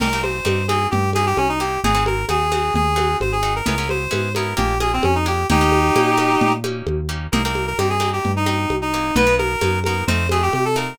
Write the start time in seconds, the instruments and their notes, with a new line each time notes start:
0.00 synth bass 1 C2, acoustic guitar (steel) A#3 C4 D#4 G4, clarinet A#4, crash, low conga
0.13 acoustic guitar (steel) A#3 C4 D#4 G4
0.23 clarinet C5, high conga
0.45 synth bass 1 G2, acoustic guitar (steel) A#3 C4 D#4 G4, high conga
0.68 acoustic guitar (steel) A#3 C4 D#4 G4, clarinet G#4, high conga
0.91 synth bass 1 G2, clarinet G4, low conga
1.13 acoustic guitar (steel) A#3 C4 D#4 G4, clarinet G#4, high conga
1.26 clarinet G4
1.37 synth bass 1 C2, clarinet C#4, high conga
1.49 clarinet D#4
1.60 acoustic guitar (steel) A#3 C4 D#4 G4, clarinet G4
1.84 synth bass 1 G#1, acoustic guitar (steel) C4 D#4 F#4 G#4, clarinet G#4, low conga
1.95 acoustic guitar (steel) C4 D#4 F#4 G#4
2.06 clarinet A#4, high conga
2.29 synth bass 1 D#2, acoustic guitar (steel) C4 D#4 F#4 G#4, clarinet G#4, high conga
2.52 acoustic guitar (steel) C4 D#4 F#4 G#4, high conga
2.74 synth bass 1 D#2, clarinet G#4, low conga
2.96 acoustic guitar (steel) C4 D#4 F#4 G#4, high conga
3.20 synth bass 1 G#1, clarinet C5, high conga
3.32 clarinet G#4
3.43 acoustic guitar (steel) C4 D#4 F#4 G#4
3.56 clarinet A#4
3.66 synth bass 1 C#2, acoustic guitar (steel) B3 C#4 E4 G#4, clarinet A#4, low conga
3.78 acoustic guitar (steel) B3 C#4 E4 G#4
3.89 clarinet C5, high conga
4.11 synth bass 1 G#2, acoustic guitar (steel) B3 C#4 E4 G#4, high conga
4.35 acoustic guitar (steel) B3 C#4 E4 G#4, clarinet A#4, high conga
4.57 synth bass 1 A#1, acoustic guitar (steel) A#3 D4 F4 G#4, clarinet G4, low conga
4.80 acoustic guitar (steel) A#3 D4 F4 G#4, clarinet G#4, high conga
4.93 clarinet C4
5.03 synth bass 1 F2, clarinet C#4, high conga
5.15 clarinet D#4
5.26 acoustic guitar (steel) A#3 D4 F4 G#4, clarinet G4
5.50 synth bass 1 D#2, acoustic guitar (steel) A#3 C#4 D#4 G4, clarinet D#4 G4, low conga
5.61 acoustic guitar (steel) A#3 C#4 D#4 G4
5.72 high conga
5.96 synth bass 1 A#2, acoustic guitar (steel) A#3 C#4 D#4 G4, high conga
6.17 acoustic guitar (steel) A#3 C#4 D#4 G4, high conga
6.41 synth bass 1 A#2, low conga
6.64 acoustic guitar (steel) A#3 C#4 D#4 G4, high conga
6.87 synth bass 1 D#2, high conga
7.09 acoustic guitar (steel) A#3 C#4 D#4 G4
7.32 synth bass 1 C2, acoustic guitar (steel) A#3 C4 D#4 G4, clarinet A#4, low conga
7.45 acoustic guitar (steel) A#3 C4 D#4 G4, clarinet A#4
7.55 high conga
7.67 clarinet A#4
7.78 synth bass 1 G2, acoustic guitar (steel) A#3 C4 D#4 G4, clarinet G4, high conga
7.90 clarinet G#4
8.00 acoustic guitar (steel) A#3 C4 D#4 G4, high conga
8.13 clarinet G4
8.25 synth bass 1 G2, low conga
8.36 clarinet D#4
8.46 acoustic guitar (steel) A#3 C4 D#4 G4, clarinet D#4, high conga
8.70 synth bass 1 C2, high conga
8.82 clarinet D#4
8.94 acoustic guitar (steel) A#3 C4 D#4 G4
9.15 synth bass 1 B1, acoustic guitar (steel) A#3 B3 D#4 F#4, clarinet B4, low conga
9.27 acoustic guitar (steel) A#3 B3 D#4 F#4
9.38 clarinet A#4, high conga
9.61 synth bass 1 F#2, acoustic guitar (steel) A#3 B3 D#4 F#4, high conga
9.84 acoustic guitar (steel) A#3 B3 D#4 F#4, clarinet A#4, high conga
10.07 synth bass 1 F2, acoustic guitar (steel) A3 C4 D#4 F4, clarinet C5, low conga
10.29 acoustic guitar (steel) A3 C4 D#4 F4, clarinet G#4, high conga
10.42 clarinet G4
10.53 synth bass 1 C3, clarinet G4, high conga
10.65 clarinet A4
10.76 acoustic guitar (steel) A3 C4 D#4 F4, clarinet A#4